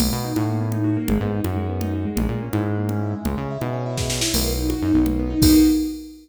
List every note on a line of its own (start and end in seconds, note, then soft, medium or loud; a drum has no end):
0.00 0.10 B1 loud
0.00 0.11 A#3 medium
0.00 crash medium
0.00 low conga loud
0.12 0.33 B2 medium
0.12 0.23 B3 medium
0.24 0.35 D#4 medium
0.36 0.98 A2 medium
0.36 0.47 F#4 medium
0.36 high conga medium
0.49 0.60 A#3 medium
0.61 0.72 B3 medium
0.72 0.84 D#4 medium
0.72 low conga medium
0.84 0.95 F#4 medium
0.97 1.07 A#3 medium
1.08 1.19 G#1 loud
1.08 1.20 G#3 medium
1.08 low conga loud
1.20 1.41 G#2 loud
1.20 1.31 B3 medium
1.31 1.42 D#4 medium
1.44 2.06 F#2 loud
1.44 1.56 F#4 medium
1.44 high conga medium
1.56 1.67 G#3 medium
1.69 1.80 B3 medium
1.81 1.92 D#4 medium
1.81 low conga medium
1.93 2.04 F#4 medium
2.05 2.15 G#3 medium
2.16 2.27 A#1 loud
2.16 2.27 G#3 medium
2.16 low conga loud
2.29 2.49 A#2 medium
2.29 2.41 A#3 medium
2.42 2.53 C#4 medium
2.53 3.15 G#2 loud
2.53 2.64 E4 medium
2.53 high conga medium
2.65 2.76 G#3 medium
2.77 2.88 A#3 medium
2.89 3.00 C#4 medium
2.89 low conga medium
3.01 3.12 E4 medium
3.13 3.24 G#3 medium
3.25 3.36 C#2 loud
3.25 3.36 G#3 medium
3.25 low conga medium
3.37 3.58 C#3 medium
3.37 3.48 C#4 medium
3.50 3.61 E4 medium
3.60 4.23 B2 loud
3.60 3.71 G#3 medium
3.60 high conga medium
3.73 3.84 C#4 medium
3.86 3.97 E4 medium
3.97 4.08 G#3 medium
3.97 kick medium
3.97 snare medium
4.09 4.20 C#4 medium
4.09 snare medium
4.21 4.31 E4 medium
4.21 snare loud
4.34 4.75 B1 loud
4.34 4.46 A#3 loud
4.34 crash loud
4.34 low conga medium
4.46 4.57 B3 medium
4.58 4.69 D#4 medium
4.70 4.80 F#4 medium
4.70 high conga medium
4.82 4.92 F#2 medium
4.82 4.93 D#4 medium
4.94 5.35 B1 loud
4.94 5.05 B3 medium
5.06 5.16 A#3 medium
5.06 low conga medium
5.19 5.30 B3 medium
5.30 5.41 D#4 medium
5.42 5.55 B1 loud
5.42 5.56 A#3 loud
5.42 5.56 B3 loud
5.42 5.56 D#4 loud
5.42 5.56 F#4 loud
5.42 kick loud
5.42 crash loud